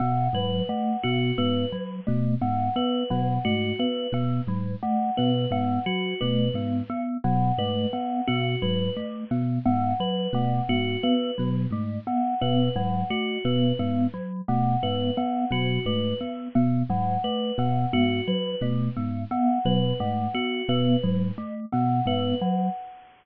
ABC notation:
X:1
M:6/8
L:1/8
Q:3/8=58
K:none
V:1 name="Electric Piano 1" clef=bass
B,, _A,, z B,, A,, z | B,, _A,, z B,, A,, z | B,, _A,, z B,, A,, z | B,, _A,, z B,, A,, z |
B,, _A,, z B,, A,, z | B,, _A,, z B,, A,, z | B,, _A,, z B,, A,, z | B,, _A,, z B,, A,, z |
B,, _A,, z B,, A,, z | B,, _A,, z B,, A,, z | B,, _A,, z B,, A,, z |]
V:2 name="Glockenspiel"
B, _G, A, B, B, G, | A, B, B, _G, A, B, | B, _G, A, B, B, G, | A, B, B, _G, A, B, |
B, _G, A, B, B, G, | A, B, B, _G, A, B, | B, _G, A, B, B, G, | A, B, B, _G, A, B, |
B, _G, A, B, B, G, | A, B, B, _G, A, B, | B, _G, A, B, B, G, |]
V:3 name="Tubular Bells"
_g B g _G B z | z _g B g _G B | z2 _g B g _G | B z2 _g B g |
_G B z2 _g B | _g _G B z2 g | B _g _G B z2 | _g B g _G B z |
z _g B g _G B | z2 _g B g _G | B z2 _g B g |]